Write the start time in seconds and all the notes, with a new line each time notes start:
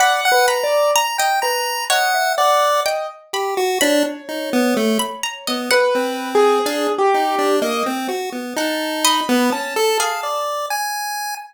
0.00 D5 F#5 B5
0.25 F#5
0.32 B4
0.48 A#5 B5
0.63 D5
0.95 A#5
1.18 D#5 G5
1.42 B4 A#5
1.90 C#5 D#5 F#5
2.14 E5
2.38 D5 F#5
2.86 D#5 G5
3.33 G4 B5
3.57 F#4
3.81 D4 C#5 B5
4.29 D#4
4.53 B3
4.77 A3
4.99 B5
5.23 A#5
5.47 B3 D#5
5.71 B4 F#5
5.95 C4
6.35 G#4
6.66 D4 F5
6.98 G4
7.14 D#4
7.38 D4
7.62 A#3 D#5
7.86 C4
8.08 F#4
8.32 B3
8.56 D#4 F#5 A5
9.05 D#5 B5
9.29 B3
9.52 C#4 A5
9.76 A4
9.99 G#4 F5
10.23 D5
10.70 G#5